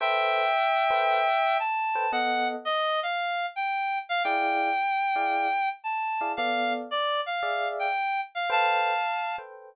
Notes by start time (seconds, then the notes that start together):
0.00 A4 B4 C5 E5 G5
0.90 A4 B4 C5 G5
1.59 A5
1.95 A4 B4 C5 G5
2.12 B3 A4 D#5 F#5
2.65 D#5
3.03 F5
3.56 G5
4.09 F5
4.24 E4 G#4 D5 F5 G5
5.16 E4 G#4 D5 F5
5.84 A5
6.21 E4 G#4 D5 F5
6.37 B3 A4 D5 F5
6.91 D5
7.26 F5
7.43 G#4 D5 E5 F5
7.79 G5
8.35 F5
8.50 A4 B4 C5 F5 G5 A5
9.38 A4 B4 C5 G5